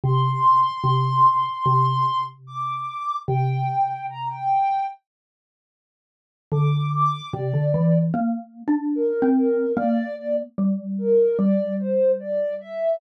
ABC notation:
X:1
M:4/4
L:1/16
Q:1/4=74
K:Gdor
V:1 name="Ocarina"
c'12 d'4 | g4 b g3 z8 | d'2 d'2 d4 z4 B2 B2 | d2 d z3 B2 d2 c2 d2 e2 |]
V:2 name="Xylophone"
C,4 C,4 C,8 | C,8 z8 | D,4 C, D, E,2 (3B,4 D4 C4 | B,4 G,4 G,8 |]